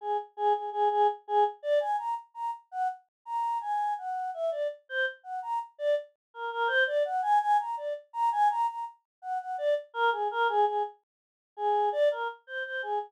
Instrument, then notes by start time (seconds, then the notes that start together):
choir aahs
0.01 G#4
0.37 G#4
0.53 G#4
0.72 G#4
0.91 G#4
1.28 G#4
1.63 D5
1.80 G#5
1.98 A#5
2.34 A#5
2.71 F#5
3.25 A#5
3.61 G#5
3.98 F#5
4.34 E5
4.51 D5
4.89 C5
5.23 F#5
5.42 A#5
5.78 D5
6.34 A#4
6.52 A#4
6.67 C5
6.87 D5
7.05 F#5
7.22 G#5
7.41 G#5
7.59 A#5
7.77 D5
8.13 A#5
8.32 G#5
8.50 A#5
8.68 A#5
9.22 F#5
9.40 F#5
9.58 D5
9.94 A#4
10.12 G#4
10.31 A#4
10.49 G#4
10.66 G#4
11.57 G#4
11.92 D5
12.11 A#4
12.47 C5
12.65 C5
12.83 G#4